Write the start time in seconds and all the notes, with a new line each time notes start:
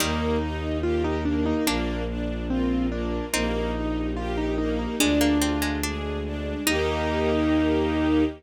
0.00 D#2 D#3 G3 A#3 D#4 G4
0.42 D#4
0.83 A#3 F4 G4 A#4
1.04 D#4
1.25 A#3 D4
1.46 D#4
1.67 A#1 A#3 D4 F4
2.09 D4
2.49 A#3 C4 F4 A#4
2.91 A#3 D4
3.33 A#1 A#3 C4 D#4 G4
3.75 D#4
4.16 A#3 F4 G4 A#4
4.37 D#4
4.58 A#3 D#4
4.79 D#4
5.00 D2 G#3 D4 F4 G#4
5.21 A#3
5.40 C4 F4
5.62 G#3
5.83 G#3 D4 G#4
6.26 D4
6.66 D#2 A#3 D#4 G4